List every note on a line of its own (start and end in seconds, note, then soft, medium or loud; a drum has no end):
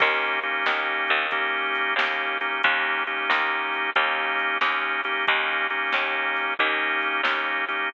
0.00 0.63 D#2 medium
0.00 0.39 A#3 medium
0.00 0.39 C#4 loud
0.00 0.39 D#4 medium
0.00 0.39 G4 loud
0.00 kick loud
0.00 crash loud
0.43 1.27 A#3 medium
0.43 1.27 C#4 medium
0.43 1.27 D#4 medium
0.43 1.27 G4 medium
0.43 closed hi-hat medium
0.66 1.07 D#2 medium
0.66 snare loud
1.08 1.94 D#2 medium
1.08 closed hi-hat medium
1.31 1.94 A#3 loud
1.31 1.94 C#4 medium
1.31 1.94 D#4 medium
1.31 1.94 G4 loud
1.31 kick medium
1.31 closed hi-hat loud
1.75 closed hi-hat medium
1.96 2.57 D#2 medium
1.96 2.38 A#3 medium
1.96 2.38 C#4 medium
1.96 2.38 D#4 medium
1.96 2.38 G4 medium
1.96 snare loud
2.41 2.62 A#3 medium
2.41 2.62 C#4 medium
2.41 2.62 D#4 medium
2.41 2.62 G4 medium
2.41 closed hi-hat medium
2.63 3.25 D#2 medium
2.63 3.03 A#3 loud
2.63 3.03 C#4 loud
2.63 3.03 D#4 loud
2.63 3.03 G4 loud
2.63 kick loud
2.63 closed hi-hat loud
3.07 3.90 A#3 medium
3.07 3.90 C#4 medium
3.07 3.90 D#4 medium
3.07 3.90 G4 medium
3.07 closed hi-hat medium
3.30 3.91 D#2 medium
3.30 snare loud
3.73 closed hi-hat medium
3.95 4.57 D#2 medium
3.95 4.58 A#3 loud
3.95 4.58 C#4 medium
3.95 4.58 D#4 loud
3.95 4.58 G4 medium
3.95 kick medium
3.95 closed hi-hat loud
4.39 closed hi-hat medium
4.61 5.23 D#2 medium
4.61 5.01 A#3 medium
4.61 5.01 C#4 medium
4.61 5.01 D#4 medium
4.61 5.01 G4 medium
4.61 snare loud
5.04 5.26 A#3 medium
5.04 5.26 C#4 medium
5.04 5.26 D#4 medium
5.04 5.26 G4 loud
5.04 closed hi-hat medium
5.27 5.90 D#2 medium
5.27 5.67 A#3 loud
5.27 5.67 C#4 loud
5.27 5.67 D#4 loud
5.27 5.67 G4 loud
5.27 kick loud
5.27 closed hi-hat loud
5.70 6.54 A#3 medium
5.70 6.54 C#4 medium
5.70 6.54 D#4 medium
5.70 6.54 G4 medium
5.70 closed hi-hat medium
5.92 6.55 D#2 medium
5.92 snare loud
6.36 closed hi-hat medium
6.59 7.21 D#2 medium
6.59 7.21 A#3 loud
6.59 7.21 C#4 loud
6.59 7.21 D#4 loud
6.59 7.21 G4 loud
6.59 kick medium
6.59 closed hi-hat loud
7.02 closed hi-hat medium
7.23 7.85 D#2 medium
7.23 7.65 A#3 medium
7.23 7.65 C#4 medium
7.23 7.65 D#4 medium
7.23 7.65 G4 medium
7.23 snare loud
7.68 7.89 A#3 medium
7.68 7.89 C#4 medium
7.68 7.89 D#4 medium
7.68 7.89 G4 medium
7.68 closed hi-hat medium